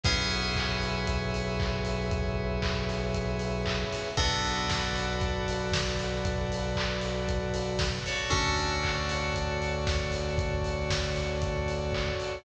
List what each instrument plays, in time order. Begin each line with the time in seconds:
0.03 synth bass 1 B1, electric piano 2 B3 C#4 E4 G#4 B4 C#5 E5, kick, closed hi-hat
0.31 open hi-hat
0.56 kick, clap
0.81 open hi-hat
1.07 kick, closed hi-hat
1.34 open hi-hat
1.60 kick, clap
1.85 open hi-hat
2.11 kick, closed hi-hat
2.62 kick, clap
2.89 open hi-hat
3.14 kick, closed hi-hat
3.39 open hi-hat
3.66 kick, clap
3.92 open hi-hat
4.17 synth bass 1 B1, electric piano 2 B3 D4 F#4 A4 B4 D5, kick, closed hi-hat
4.44 open hi-hat
4.70 kick, snare
4.96 open hi-hat
5.21 kick, closed hi-hat
5.48 open hi-hat
5.72 kick, snare
5.99 open hi-hat
6.25 kick, closed hi-hat
6.52 open hi-hat
6.76 kick, clap
7.01 open hi-hat
7.28 kick, closed hi-hat
7.54 open hi-hat
7.79 kick, snare
8.06 electric piano 2 F#4 A4 C#5 D5, open hi-hat
8.30 synth bass 1 D2, electric piano 2 C#4 D4 F#4 A4, kick, closed hi-hat
8.57 open hi-hat
8.84 kick, clap
9.09 open hi-hat
9.34 kick, closed hi-hat
9.62 open hi-hat
9.87 kick, snare
10.12 open hi-hat
10.38 kick, closed hi-hat
10.64 open hi-hat
10.90 kick, snare
11.16 open hi-hat
11.42 kick, closed hi-hat
11.68 open hi-hat
11.93 kick, clap
12.20 open hi-hat